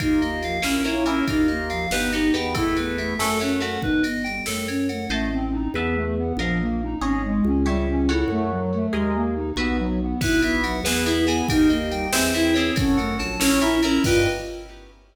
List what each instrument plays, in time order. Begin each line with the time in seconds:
0.00 drawbar organ D#2, overdriven guitar A#3 D#4 F4, ocarina D#4, electric piano 2 A#4, kick, ride
0.21 ocarina A#3, electric piano 2 D#5, ride
0.42 ocarina F3, electric piano 2 F5, ride
0.62 drawbar organ A#1, overdriven guitar A#3 C#4 E4, ocarina C#4, electric piano 2 A#4, snare
0.84 overdriven guitar A#3 C#4 E4, ocarina E4, electric piano 2 C#5, ride
1.05 overdriven guitar A#3 C#4 E4, ocarina C#4, electric piano 2 A#4, ride
1.28 drawbar organ D#2, overdriven guitar A#3 D#4 F4, ocarina D#4, kick, ride
1.48 ocarina A#3, electric piano 2 D#5, ride
1.70 ocarina F3, electric piano 2 F5, ride
1.90 drawbar organ G1, ocarina B3, overdriven guitar B3 D#4 G4, electric piano 2 B4, snare
2.12 overdriven guitar B3 D#4 G4, ocarina D#4, electric piano 2 D#5, ride
2.34 drawbar organ E2, overdriven guitar B3 D#4 G4, ocarina B3, electric piano 2 G5, ride
2.54 overdriven guitar A3 B3 E4, ocarina E4, electric piano 2 A4, kick, ride
2.77 ocarina B3, electric piano 2 B4, ride
2.98 ocarina A3, electric piano 2 E5, ride
3.19 drawbar organ F#2, overdriven guitar A3 C#4 F#4, ocarina A3, electric piano 2 A4, snare
3.40 overdriven guitar A3 C#4 F#4, ocarina C#4, electric piano 2 C#5, ride
3.60 ocarina A3, overdriven guitar A3 C#4 F#4, electric piano 2 F#5, ride
3.82 drawbar organ G1, ocarina D#4, electric piano 2 B4, kick
4.03 ocarina B3, electric piano 2 D#5, ride
4.24 ocarina G3, electric piano 2 G5, ride
4.46 drawbar organ F#2, ocarina A3, electric piano 2 A4, snare
4.68 ocarina C#4, electric piano 2 C#5, ride
4.89 ocarina A3, electric piano 2 F#5, ride
5.09 drawbar organ A1, flute A3, overdriven guitar C5 D#5 A5
5.33 flute C4
5.52 flute D#4
5.74 drawbar organ E2, flute B3, overdriven guitar B4 E5 A5
5.95 flute A3
6.17 flute B3
6.37 drawbar organ A#1, flute F3, overdriven guitar A#4 D#5 F5
6.60 flute A#3
6.82 flute D#4
7.01 drawbar organ G#1, flute C#4, overdriven guitar G#4 C#5 D#5
7.24 flute G#3
7.45 drawbar organ C#2, flute C#4
7.65 flute G3, overdriven guitar G4 C#5 E5
7.88 flute C#4
8.09 flute E4, overdriven guitar F#4 A4 C#5
8.28 drawbar organ F#2, flute A3
8.51 flute F#3
8.74 flute A3
8.93 drawbar organ D#2, flute G#3, overdriven guitar G#4 A#4 D#5
9.14 flute A#3
9.36 flute D#4
9.56 drawbar organ B1, flute B3, overdriven guitar F#4 B4 E5
9.79 flute F#3
10.00 flute B3
10.21 drawbar organ B1, overdriven guitar B3 E4 F#4, ocarina E4, electric piano 2 B4, kick, crash
10.42 ocarina B3, electric piano 2 E5, ride
10.64 ocarina F#3, electric piano 2 F#5, ride
10.83 drawbar organ E2, overdriven guitar B3 E4 G#4, ocarina B3, electric piano 2 B4, snare
11.05 overdriven guitar B3 E4 G#4, ocarina E4, electric piano 2 E5, ride
11.27 ocarina B3, overdriven guitar B3 E4 G#4, electric piano 2 G#5, ride
11.48 drawbar organ D#2, overdriven guitar A#3 D#4 G4, ocarina D#4, electric piano 2 A#4, kick, ride
11.69 ocarina A#3, electric piano 2 D#5, ride
11.91 ocarina G3, electric piano 2 G5, ride
12.12 drawbar organ E2, ocarina C4, overdriven guitar C4 E4 G#4, electric piano 2 C5, snare
12.34 overdriven guitar C4 E4 G#4, ocarina E4, electric piano 2 E5, ride
12.54 ocarina C4, overdriven guitar C4 E4 G#4, electric piano 2 C#5, ride
12.76 drawbar organ F#2, overdriven guitar C#4 F#4 A4, ocarina C#4, kick, ride
12.97 ocarina A3, electric piano 2 F#5, ride
13.19 drawbar organ A#1, ocarina F#3, electric piano 2 A5, ride
13.40 overdriven guitar C#4 E4 A#4, ocarina C#4, electric piano 2 C#5, snare
13.61 overdriven guitar C#4 E4 A#4, ocarina E4, electric piano 2 E5, ride
13.83 ocarina C#4, overdriven guitar C#4 E4 A#4, electric piano 2 A#5, ride
14.04 drawbar organ G2, overdriven guitar B3 D#4 G4, ocarina F4, electric piano 2 B4 D#5 G5, kick, crash